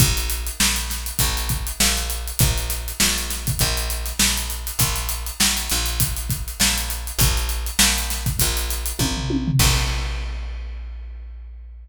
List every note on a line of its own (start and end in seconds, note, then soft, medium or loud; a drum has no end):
0.00 0.51 A#1 loud
0.00 kick loud
0.00 closed hi-hat loud
0.17 closed hi-hat medium
0.30 closed hi-hat medium
0.47 closed hi-hat medium
0.60 1.12 A#1 medium
0.60 snare loud
0.76 closed hi-hat medium
0.90 snare medium
0.90 closed hi-hat medium
1.06 closed hi-hat medium
1.19 1.72 A#1 loud
1.19 kick medium
1.19 closed hi-hat loud
1.37 closed hi-hat medium
1.49 kick medium
1.49 closed hi-hat medium
1.67 closed hi-hat medium
1.80 2.32 A#1 medium
1.80 snare loud
1.97 closed hi-hat medium
2.10 closed hi-hat medium
2.27 closed hi-hat medium
2.39 2.92 A#1 medium
2.39 kick loud
2.39 closed hi-hat loud
2.58 closed hi-hat medium
2.70 snare soft
2.70 closed hi-hat medium
2.88 closed hi-hat medium
3.00 3.52 A#1 medium
3.00 snare loud
3.17 snare soft
3.17 closed hi-hat medium
3.30 snare medium
3.30 closed hi-hat medium
3.47 kick medium
3.47 closed hi-hat medium
3.59 4.13 A#1 loud
3.59 kick medium
3.59 closed hi-hat medium
3.77 closed hi-hat medium
3.90 closed hi-hat medium
4.06 snare soft
4.06 closed hi-hat medium
4.19 4.71 A#1 medium
4.19 snare loud
4.37 closed hi-hat medium
4.50 closed hi-hat medium
4.67 closed hi-hat medium
4.79 5.31 A#1 medium
4.79 kick medium
4.79 closed hi-hat loud
4.96 snare soft
4.96 closed hi-hat medium
5.09 closed hi-hat medium
5.26 closed hi-hat medium
5.40 5.69 A#1 medium
5.40 snare loud
5.57 closed hi-hat medium
5.70 6.54 A#1 medium
5.70 snare medium
5.70 closed hi-hat medium
5.86 closed hi-hat medium
6.00 kick loud
6.00 closed hi-hat loud
6.17 closed hi-hat medium
6.29 kick medium
6.29 closed hi-hat medium
6.48 closed hi-hat medium
6.60 7.12 A#1 medium
6.60 snare loud
6.78 closed hi-hat medium
6.90 closed hi-hat medium
7.07 closed hi-hat medium
7.19 7.71 A#1 loud
7.19 kick loud
7.19 closed hi-hat loud
7.37 closed hi-hat medium
7.49 closed hi-hat medium
7.66 closed hi-hat medium
7.79 8.31 A#1 medium
7.79 snare loud
7.98 closed hi-hat medium
8.10 snare medium
8.10 closed hi-hat medium
8.26 kick medium
8.26 closed hi-hat medium
8.39 8.93 A#1 loud
8.39 kick medium
8.39 closed hi-hat loud
8.57 closed hi-hat medium
8.70 snare soft
8.70 closed hi-hat medium
8.86 closed hi-hat medium
8.99 9.51 A#1 medium
8.99 kick medium
8.99 high tom medium
9.17 floor tom medium
9.30 high tom medium
9.47 floor tom loud
9.59 11.88 A#1 loud
9.59 kick loud
9.59 crash loud